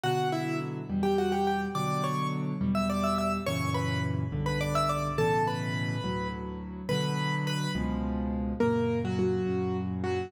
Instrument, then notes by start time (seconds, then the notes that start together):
acoustic grand piano
0.04 B2 D3 F#3 F#4 F#5
0.32 E4 E5
0.90 E2 B2 G3
1.03 G4 G5
1.18 F#4 F#5
1.32 G4 G5
1.47 G4 G5
1.75 B2 D3 F#3 D5 D6
2.04 C#5 C#6
2.61 E2 B2 G3
2.75 E5 E6
2.90 D5 D6
3.04 E5 E6
3.18 E5 E6
3.46 F#2 A#2 C#3 E3 C#5 C#6
3.74 B4 B5
4.32 B1 G2 D3
4.46 B4 B5
4.61 D5 D6
4.75 E5 E6
4.89 D5 D6
5.18 A2 B2 C#3 E3 A4 A5
5.47 B4 B5
6.04 D2 A2 F#3
6.89 B2 D3 F#3 B4 B5
7.47 B4 B5
7.75 C#2 B2 F3 G#3
8.60 F#2 A#2 C#3 A#3 A#4
9.05 F#3 F#4
9.19 F#3 F#4
9.46 F#2 A#2 C#3
10.04 F#3 F#4